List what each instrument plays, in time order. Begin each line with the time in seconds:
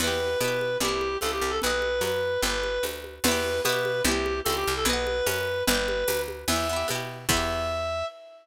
0.00 electric bass (finger) E2, acoustic guitar (steel) B3 E4, clarinet B4, crash, cowbell, low conga
0.07 acoustic guitar (steel) G4
0.20 high conga
0.40 electric bass (finger) B2, acoustic guitar (steel) B3 E4, clarinet B4, tambourine, cowbell, high conga
0.48 acoustic guitar (steel) G4
0.61 high conga
0.80 electric bass (finger) C2, acoustic guitar (steel) C4, clarinet G4, cowbell, low conga
0.85 acoustic guitar (steel) E4 G4
1.01 high conga
1.21 electric bass (finger) C#2, acoustic guitar (steel) C4, clarinet A4, tambourine, cowbell, high conga
1.25 acoustic guitar (steel) E4 G4
1.32 clarinet G4
1.41 electric bass (finger) C2
1.50 clarinet A4
1.62 electric bass (finger) B1, clarinet B4, acoustic guitar (steel) B4, cowbell, low conga
1.67 acoustic guitar (steel) D#5 F#5
1.82 high conga
2.01 electric bass (finger) F#2, clarinet B4, tambourine, cowbell, high conga
2.42 electric bass (finger) G1, acoustic guitar (steel) B4, clarinet B4, cowbell, low conga
2.47 acoustic guitar (steel) D5 G5
2.63 high conga
2.83 electric bass (finger) D2, tambourine, cowbell, high conga
3.04 high conga
3.24 electric bass (finger) E2, acoustic guitar (steel) B3, clarinet B4, crash, cowbell, low conga
3.28 acoustic guitar (steel) E4 G4
3.44 high conga
3.64 electric bass (finger) B2, acoustic guitar (steel) B3, clarinet B4, tambourine, cowbell, high conga
3.69 acoustic guitar (steel) E4 G4
3.85 high conga
4.04 electric bass (finger) C2, acoustic guitar (steel) C4 E4, clarinet G4, cowbell, low conga
4.11 acoustic guitar (steel) G4
4.26 high conga
4.45 electric bass (finger) C#2, acoustic guitar (steel) C4, clarinet A4, tambourine, cowbell, high conga
4.49 acoustic guitar (steel) E4 G4
4.56 clarinet G4
4.67 electric bass (finger) C2
4.77 clarinet A4
4.85 electric bass (finger) B1, acoustic guitar (steel) B4, clarinet B4, cowbell, low conga
4.90 acoustic guitar (steel) D#5 F#5
5.07 high conga
5.26 electric bass (finger) F#2, clarinet B4, tambourine, cowbell, high conga
5.67 electric bass (finger) G1, acoustic guitar (steel) B4 D5, clarinet B4, cowbell, low conga
5.74 acoustic guitar (steel) G5
5.88 high conga
6.08 electric bass (finger) D2, tambourine, cowbell, high conga
6.28 high conga
6.48 electric bass (finger) E2, acoustic guitar (steel) B3, clarinet E5, crash, cowbell, low conga
6.53 acoustic guitar (steel) E4 G4
6.69 acoustic guitar (steel) B3 E4
6.76 acoustic guitar (steel) G4
6.88 electric bass (finger) B2, acoustic guitar (steel) B3 E4, tambourine, cowbell, high conga
6.95 acoustic guitar (steel) G4
7.29 electric bass (finger) E2, acoustic guitar (steel) B3, clarinet E5, kick, crash
7.33 acoustic guitar (steel) E4 G4